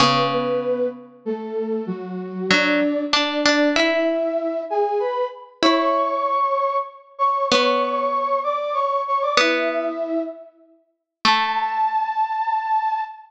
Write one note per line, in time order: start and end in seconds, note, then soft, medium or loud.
0.00 1.79 C#3 loud
0.00 0.28 B3 medium
0.00 0.28 B4 medium
0.32 0.86 B3 medium
0.32 0.86 B4 medium
1.25 1.85 A3 medium
1.25 1.85 A4 medium
1.87 2.48 F#3 medium
1.87 2.48 F#4 medium
2.49 2.80 F#3 medium
2.49 3.01 D4 medium
2.49 3.01 D5 medium
3.12 3.68 D4 medium
3.12 3.43 D4 medium
3.12 3.68 D5 medium
3.46 3.75 D4 loud
3.75 4.61 E4 medium
3.75 5.34 E4 loud
3.75 4.61 E5 medium
4.70 4.99 G#4 medium
4.70 4.99 G#5 medium
5.00 5.25 B4 medium
5.00 5.25 B5 medium
5.63 6.23 E4 medium
5.63 6.77 C#5 medium
5.63 6.77 C#6 loud
7.18 7.46 C#5 medium
7.18 7.46 C#6 medium
7.50 9.30 B3 loud
7.50 8.39 C#5 medium
7.50 8.39 C#6 medium
8.43 8.74 D5 medium
8.43 8.74 D6 medium
8.74 9.02 C#5 medium
8.74 9.02 C#6 medium
9.07 9.22 C#5 medium
9.07 9.22 C#6 medium
9.22 9.37 D5 medium
9.22 9.37 D6 medium
9.37 9.89 B3 loud
9.37 10.20 E4 medium
9.37 10.20 E5 medium
11.25 13.01 A3 loud
11.25 13.02 A5 loud